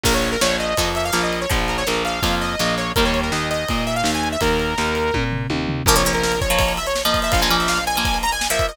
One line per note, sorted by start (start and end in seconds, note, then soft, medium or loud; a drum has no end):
0.03 0.36 A#1 medium
0.03 0.38 F3 medium
0.03 0.38 A#3 medium
0.03 0.13 A#4 loud
0.03 kick loud
0.03 crash loud
0.14 0.30 C#5 medium
0.22 ride medium
0.32 0.41 A#4 loud
0.41 0.74 A#1 medium
0.41 0.74 F3 medium
0.41 0.74 A#3 medium
0.41 0.57 C#5 loud
0.41 snare loud
0.59 0.89 D#5 medium
0.59 ride medium
0.77 1.11 F2 medium
0.77 1.11 F3 medium
0.77 1.11 A#3 medium
0.77 kick medium
0.77 ride loud
0.95 1.04 E5 medium
0.95 ride medium
1.05 1.22 F5 loud
1.12 1.46 A#1 medium
1.12 1.45 F3 medium
1.12 1.45 A#3 medium
1.12 snare loud
1.23 1.40 D#5 medium
1.33 ride medium
1.41 1.50 C#5 medium
1.50 1.84 A#1 medium
1.50 1.82 F3 medium
1.50 1.82 A#3 medium
1.50 1.59 F4 medium
1.50 kick loud
1.50 ride loud
1.68 1.77 A#4 medium
1.68 ride medium
1.78 1.86 C#5 loud
1.87 2.20 A#1 medium
1.87 2.20 F3 medium
1.87 2.20 A#3 medium
1.87 2.03 A#4 medium
1.87 snare loud
2.05 2.35 F5 medium
2.05 ride medium
2.22 2.55 F2 medium
2.22 2.56 F3 medium
2.22 2.56 A#3 medium
2.22 kick loud
2.22 ride loud
2.41 2.75 D#5 medium
2.41 ride medium
2.59 2.93 A#1 medium
2.59 2.92 F3 medium
2.59 2.92 A#3 medium
2.59 snare loud
2.78 2.92 C#5 loud
2.78 ride medium
2.96 3.30 D#2 medium
2.96 5.58 D#3 medium
2.96 5.58 G3 medium
2.96 5.58 A#3 medium
2.96 3.04 A#4 loud
2.96 kick loud
2.96 ride loud
3.05 3.20 C#5 medium
3.14 ride medium
3.23 3.32 A#4 medium
3.32 3.65 D#2 medium
3.32 3.49 D#5 medium
3.32 snare loud
3.50 3.85 D#5 medium
3.50 ride medium
3.68 4.03 A#2 medium
3.68 kick medium
3.68 ride medium
3.87 3.95 E5 medium
3.87 ride medium
3.96 4.11 F5 loud
4.04 4.36 D#2 medium
4.04 snare loud
4.14 4.29 G#5 medium
4.23 ride medium
4.32 4.41 E5 medium
4.41 4.74 D#2 medium
4.41 5.24 A#4 loud
4.41 kick loud
4.41 ride loud
4.59 ride medium
4.78 5.11 D#2 medium
4.78 snare loud
4.95 ride medium
5.14 5.47 A#2 medium
5.14 kick medium
5.14 high tom loud
5.32 floor tom medium
5.50 5.82 D#2 medium
5.50 high tom medium
5.68 floor tom loud
5.86 7.20 A#1 medium
5.86 5.95 F3 loud
5.86 5.95 A#3 loud
5.86 5.95 A#4 loud
5.86 kick loud
5.86 crash loud
5.96 6.03 F3 medium
5.96 6.03 A#3 medium
5.96 6.12 C#5 medium
5.96 ride medium
6.05 6.35 F3 medium
6.05 6.35 A#3 medium
6.05 ride medium
6.13 6.23 A#4 loud
6.13 ride medium
6.23 6.40 A#4 loud
6.23 snare loud
6.32 ride medium
6.41 6.73 C#5 loud
6.41 kick loud
6.41 ride medium
6.50 6.79 F3 loud
6.50 6.79 A#3 medium
6.50 ride medium
6.59 kick loud
6.59 ride loud
6.68 ride medium
6.77 6.86 E5 loud
6.77 ride medium
6.87 7.02 C#5 loud
6.87 ride medium
6.96 snare loud
7.05 7.34 F3 loud
7.05 7.34 A#3 medium
7.05 7.20 D#5 medium
7.05 ride medium
7.14 kick medium
7.14 ride medium
7.22 7.32 E5 loud
7.22 ride medium
7.32 8.67 A#1 medium
7.32 7.41 F5 loud
7.32 kick loud
7.32 ride loud
7.41 7.49 F3 loud
7.41 7.49 A#3 medium
7.41 7.56 G#5 loud
7.41 ride medium
7.50 7.79 F3 medium
7.50 7.79 A#3 loud
7.50 ride medium
7.59 7.68 E5 medium
7.59 ride medium
7.68 7.84 F5 loud
7.68 snare loud
7.77 ride medium
7.87 8.18 G#5 loud
7.87 ride medium
7.96 8.26 F3 medium
7.96 8.26 A#3 medium
7.96 ride medium
8.05 kick loud
8.05 ride loud
8.14 ride medium
8.23 8.32 A#5 loud
8.23 ride medium
8.32 8.47 G#5 loud
8.32 ride medium
8.41 snare loud
8.50 8.72 F3 loud
8.50 8.72 A#3 medium
8.50 8.67 E5 loud
8.50 ride medium
8.59 kick loud
8.59 ride medium
8.69 8.76 D#5 loud
8.69 ride medium